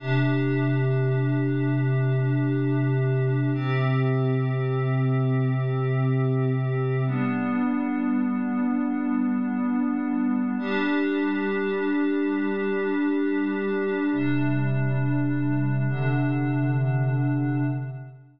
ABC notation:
X:1
M:3/4
L:1/8
Q:1/4=51
K:C
V:1 name="Pad 5 (bowed)"
[C,DG]6 | [C,CG]6 | [G,B,D]6 | [G,DG]6 |
[C,G,D]3 [C,D,D]3 |]